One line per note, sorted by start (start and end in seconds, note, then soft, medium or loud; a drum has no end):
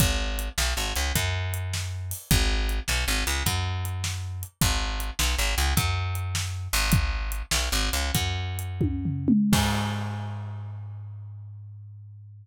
0.00 0.49 G#1 medium
0.00 kick loud
0.00 closed hi-hat loud
0.39 closed hi-hat medium
0.58 0.74 B1 medium
0.58 snare loud
0.77 0.93 G#1 medium
0.96 1.12 C#2 medium
0.96 closed hi-hat medium
1.15 2.13 F#2 medium
1.15 kick medium
1.15 closed hi-hat loud
1.54 closed hi-hat medium
1.73 snare medium
2.11 open hi-hat medium
2.31 2.80 G#1 loud
2.31 kick loud
2.31 closed hi-hat loud
2.69 closed hi-hat medium
2.88 3.05 B1 medium
2.88 snare medium
3.08 3.24 G#1 medium
3.27 3.43 C#2 medium
3.27 closed hi-hat medium
3.46 4.44 F#2 medium
3.46 kick medium
3.46 closed hi-hat loud
3.85 closed hi-hat medium
4.04 snare medium
4.43 closed hi-hat medium
4.61 5.11 G#1 medium
4.61 kick loud
4.61 closed hi-hat medium
5.00 closed hi-hat medium
5.19 5.36 B1 medium
5.19 snare loud
5.38 5.55 G#1 medium
5.58 5.74 C#2 medium
5.58 closed hi-hat medium
5.77 6.68 F#2 medium
5.77 kick medium
5.77 closed hi-hat loud
6.15 closed hi-hat medium
6.35 snare loud
6.73 7.42 G#1 medium
6.73 open hi-hat medium
6.92 kick loud
6.92 closed hi-hat loud
7.32 closed hi-hat medium
7.51 7.69 B1 medium
7.51 snare loud
7.72 7.90 G#1 medium
7.93 8.11 C#2 medium
7.93 closed hi-hat medium
8.15 9.31 F#2 medium
8.15 kick medium
8.15 closed hi-hat loud
8.59 closed hi-hat medium
8.81 kick medium
8.81 high tom medium
9.05 floor tom medium
9.28 mid tom loud
9.53 12.47 G#2 loud
9.53 kick loud
9.53 crash loud